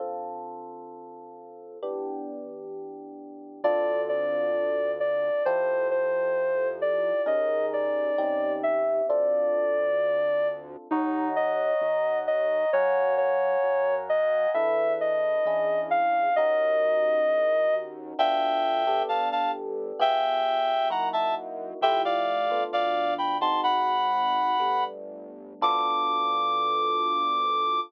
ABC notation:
X:1
M:2/2
L:1/8
Q:1/2=66
K:Ddor
V:1 name="Ocarina"
z8 | z8 | d2 d4 d2 | c2 c4 d2 |
_e2 d4 =e2 | d7 z | [K:Ebdor] E2 e4 e2 | d2 d4 e2 |
=e2 _e4 f2 | e7 z | [K:Ddor] z8 | z8 |
z8 | "^rit." z8 | z8 |]
V:2 name="Clarinet"
z8 | z8 | z8 | z8 |
z8 | z8 | [K:Ebdor] z8 | z8 |
z8 | z8 | [K:Ddor] [eg]4 [fa] [fa] z2 | [eg]4 [_g_b] [_fa] z2 |
[eg] [df]3 [df]2 [gb] [ac'] | "^rit." [_gb]6 z2 | d'8 |]
V:3 name="Electric Piano 1"
[D,CFA]8 | [E,B,DG]8 | [CDFA]8 | [EFGA]8 |
[_D_E_A_B]4 [CDEG]4 | [CDFA]8 | [K:Ebdor] [degb]8 | [fgab]8 |
[=D=E=A=B]4 [^CDE^G]4 | [DEGB]8 | [K:Ddor] [B,DFA]3 [B,DGA]5 | [B,FG_A]4 [_B,_E_F_G]4 |
[A,EFG]3 [A,B,DF]4 [_A,C_E_G]- | "^rit." [_A,C_E_G]4 [=G,=A,B,D]4 | [B,DFA]8 |]
V:4 name="Synth Bass 1" clef=bass
z8 | z8 | D,,8 | F,,8 |
_E,,4 E,,4 | D,,8 | [K:Ebdor] E,,4 E,,4 | G,,4 G,,4 |
=E,,4 E,,4 | E,,4 =E,,2 _E,,2 | [K:Ddor] D,,4 G,,,4 | G,,,4 _G,,4 |
F,,4 D,,4 | "^rit." _A,,,4 G,,,4 | D,,8 |]